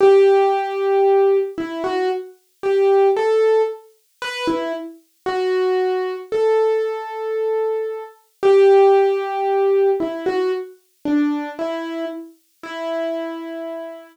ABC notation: X:1
M:4/4
L:1/16
Q:1/4=57
K:Em
V:1 name="Acoustic Grand Piano"
G6 E F z2 G2 A2 z2 | B E z2 F4 A8 | G6 E F z2 D2 E2 z2 | E6 z10 |]